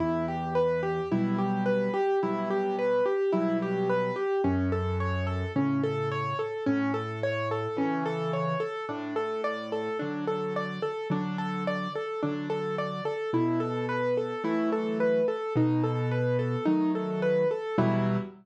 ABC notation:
X:1
M:4/4
L:1/16
Q:1/4=54
K:Em
V:1 name="Acoustic Grand Piano"
E G B G E G B G E G B G E G B G | ^C A ^c A C A c A C A c A C A c A | D A d A D A d A D A d A D A d A | E A B A E A B A ^D A B A D A B A |
E4 z12 |]
V:2 name="Acoustic Grand Piano"
E,,4 [B,,F,G,]4 [B,,F,G,]4 [B,,F,G,]4 | F,,4 [A,,^C,]4 A,,4 [C,E,]4 | A,,4 [D,F,]4 [D,F,]4 [D,F,]4 | B,,4 [E,F,A,]4 B,,4 [^D,F,A,]4 |
[E,,B,,F,G,]4 z12 |]